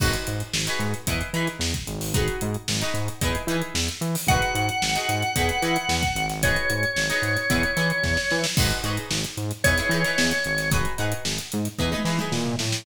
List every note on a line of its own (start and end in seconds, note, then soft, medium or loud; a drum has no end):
0.00 0.16 G#1 loud
0.00 0.43 D#4 medium
0.00 0.43 F#4 loud
0.00 0.43 G#4 medium
0.00 0.43 B4 medium
0.00 kick loud
0.00 crash loud
0.13 closed hi-hat medium
0.27 0.42 G#2 medium
0.27 closed hi-hat loud
0.40 closed hi-hat medium
0.53 0.68 G#1 loud
0.53 snare loud
0.67 0.99 D#4 medium
0.67 0.99 F#4 medium
0.67 0.99 G#4 medium
0.67 0.99 B4 medium
0.67 closed hi-hat medium
0.79 0.94 G#2 medium
0.79 closed hi-hat medium
0.94 closed hi-hat medium
1.07 1.22 E2 loud
1.07 1.29 D#4 medium
1.07 1.29 E4 medium
1.07 1.29 G#4 medium
1.07 1.29 B4 medium
1.07 kick loud
1.07 closed hi-hat loud
1.21 closed hi-hat medium
1.33 1.48 E3 medium
1.33 1.77 D#4 medium
1.33 1.77 E4 medium
1.33 1.77 G#4 medium
1.33 1.77 B4 medium
1.33 closed hi-hat medium
1.47 snare soft
1.47 closed hi-hat medium
1.59 1.74 E2 medium
1.59 snare loud
1.74 kick medium
1.74 closed hi-hat medium
1.87 2.29 G#1 loud
1.87 closed hi-hat medium
2.01 snare medium
2.01 open hi-hat medium
2.14 2.57 D#4 medium
2.14 2.57 F#4 medium
2.14 2.57 G#4 medium
2.14 2.57 B4 medium
2.14 kick loud
2.14 closed hi-hat loud
2.28 closed hi-hat medium
2.41 2.56 G#2 loud
2.41 closed hi-hat loud
2.54 closed hi-hat medium
2.68 2.83 G#1 loud
2.68 snare loud
2.81 3.14 D#4 medium
2.81 3.14 F#4 medium
2.81 3.14 G#4 medium
2.81 3.14 B4 medium
2.81 closed hi-hat medium
2.94 3.09 G#2 medium
2.94 closed hi-hat medium
3.08 closed hi-hat medium
3.21 3.36 E2 loud
3.21 3.43 D#4 medium
3.21 3.43 E4 medium
3.21 3.43 G#4 medium
3.21 3.43 B4 medium
3.21 kick loud
3.21 closed hi-hat loud
3.35 closed hi-hat medium
3.47 3.62 E3 medium
3.47 3.91 D#4 medium
3.47 3.91 E4 medium
3.47 3.91 G#4 medium
3.47 closed hi-hat medium
3.51 3.91 B4 medium
3.62 closed hi-hat medium
3.74 3.89 E2 medium
3.74 snare loud
3.89 closed hi-hat medium
4.01 4.16 E3 loud
4.01 closed hi-hat medium
4.15 snare medium
4.15 open hi-hat medium
4.27 4.41 G#1 loud
4.27 4.71 D#4 medium
4.27 4.71 F#4 medium
4.27 4.71 G#4 medium
4.27 6.26 F#5 medium
4.27 kick loud
4.27 closed hi-hat loud
4.31 4.71 B4 medium
4.42 snare soft
4.42 closed hi-hat medium
4.55 4.69 G#2 loud
4.55 closed hi-hat loud
4.69 closed hi-hat medium
4.82 4.97 G#1 medium
4.82 snare loud
4.96 5.28 D#4 medium
4.96 5.28 F#4 medium
4.96 5.28 G#4 medium
4.96 5.28 B4 medium
4.96 closed hi-hat medium
5.09 5.23 G#2 medium
5.09 closed hi-hat loud
5.22 closed hi-hat medium
5.36 5.51 E2 loud
5.36 5.57 D#4 medium
5.36 5.57 E4 medium
5.36 5.57 G#4 medium
5.36 5.57 B4 medium
5.36 kick loud
5.36 closed hi-hat loud
5.49 closed hi-hat medium
5.62 5.77 E3 medium
5.62 6.05 D#4 medium
5.62 6.05 E4 medium
5.62 6.05 G#4 medium
5.62 6.05 B4 medium
5.62 closed hi-hat medium
5.76 closed hi-hat medium
5.89 6.03 E2 loud
5.89 snare loud
6.03 kick loud
6.03 closed hi-hat medium
6.15 6.57 G#1 loud
6.15 closed hi-hat loud
6.29 snare medium
6.29 closed hi-hat medium
6.43 6.86 D#4 medium
6.43 6.86 F#4 medium
6.43 6.86 G#4 medium
6.43 6.86 B4 medium
6.43 8.40 C#5 medium
6.43 kick loud
6.43 closed hi-hat loud
6.56 closed hi-hat medium
6.70 6.85 G#2 medium
6.70 closed hi-hat loud
6.83 closed hi-hat medium
6.96 7.11 G#1 medium
6.96 snare loud
7.10 7.42 D#4 medium
7.10 7.42 F#4 medium
7.10 7.42 G#4 medium
7.10 7.42 B4 medium
7.10 closed hi-hat medium
7.22 7.37 G#2 loud
7.22 snare soft
7.22 closed hi-hat medium
7.36 snare soft
7.36 closed hi-hat medium
7.50 7.65 E2 loud
7.50 7.71 D#4 medium
7.50 7.71 E4 medium
7.50 7.71 G#4 medium
7.50 7.71 B4 medium
7.50 kick loud
7.50 closed hi-hat loud
7.63 closed hi-hat medium
7.77 7.91 E3 loud
7.77 8.20 D#4 medium
7.77 8.20 E4 medium
7.77 8.20 G#4 medium
7.77 8.20 B4 medium
7.77 closed hi-hat medium
7.90 closed hi-hat medium
8.03 8.18 E2 medium
8.03 kick medium
8.03 snare medium
8.17 snare loud
8.30 8.46 E3 medium
8.30 snare medium
8.44 snare loud
8.57 8.72 G#1 loud
8.57 8.79 D#4 medium
8.57 8.79 F#4 medium
8.57 8.79 G#4 medium
8.57 8.79 B4 medium
8.57 kick loud
8.57 crash loud
8.71 snare soft
8.71 closed hi-hat medium
8.84 8.98 G#2 medium
8.84 9.27 D#4 medium
8.84 9.27 F#4 medium
8.84 9.27 G#4 medium
8.84 9.27 B4 medium
8.84 closed hi-hat medium
8.97 closed hi-hat medium
9.11 9.25 G#1 medium
9.11 snare loud
9.24 closed hi-hat medium
9.37 9.52 G#2 loud
9.37 closed hi-hat medium
9.51 snare soft
9.51 closed hi-hat medium
9.64 9.80 E2 loud
9.64 9.75 D#4 medium
9.64 9.75 E4 medium
9.64 9.75 G#4 medium
9.64 9.75 B4 medium
9.64 10.70 C#5 medium
9.64 kick loud
9.64 closed hi-hat loud
9.78 9.88 D#4 medium
9.78 9.88 E4 medium
9.78 9.88 G#4 medium
9.78 9.88 B4 medium
9.78 closed hi-hat medium
9.89 10.04 E3 medium
9.89 10.02 D#4 medium
9.89 10.02 E4 medium
9.89 10.02 G#4 medium
9.89 closed hi-hat medium
9.94 10.02 B4 medium
10.04 10.47 D#4 medium
10.04 10.47 E4 medium
10.04 10.47 G#4 medium
10.04 10.47 B4 medium
10.04 snare medium
10.04 closed hi-hat medium
10.18 10.33 E2 medium
10.18 snare loud
10.31 closed hi-hat medium
10.44 10.87 G#1 loud
10.44 closed hi-hat medium
10.58 snare medium
10.58 closed hi-hat medium
10.71 10.93 D#4 medium
10.71 10.93 F#4 medium
10.71 10.93 G#4 loud
10.71 10.93 B4 medium
10.71 kick loud
10.71 closed hi-hat loud
10.85 closed hi-hat medium
10.98 11.14 G#2 medium
10.98 11.41 D#4 medium
10.98 11.41 F#4 medium
10.98 11.41 G#4 medium
10.98 11.41 B4 medium
10.98 closed hi-hat medium
11.12 closed hi-hat loud
11.25 11.40 G#1 medium
11.25 snare loud
11.38 closed hi-hat medium
11.52 11.68 G#2 medium
11.52 closed hi-hat loud
11.65 snare soft
11.65 closed hi-hat medium
11.79 11.94 E2 loud
11.79 11.89 D#4 medium
11.79 11.89 E4 loud
11.79 11.89 G#4 medium
11.79 11.89 B4 medium
11.79 kick medium
11.92 12.03 D#4 medium
11.92 12.03 E4 medium
11.92 12.03 G#4 medium
11.92 12.03 B4 medium
11.92 high tom loud
12.05 12.19 E3 medium
12.05 12.16 D#4 medium
12.05 12.16 E4 medium
12.05 12.16 G#4 medium
12.05 12.16 B4 medium
12.05 snare medium
12.19 12.62 D#4 medium
12.19 12.62 E4 medium
12.19 12.62 G#4 medium
12.19 12.62 B4 medium
12.19 mid tom loud
12.32 12.56 A#2 medium
12.32 snare loud
12.46 floor tom loud
12.59 12.84 A2 loud
12.59 snare loud
12.72 snare loud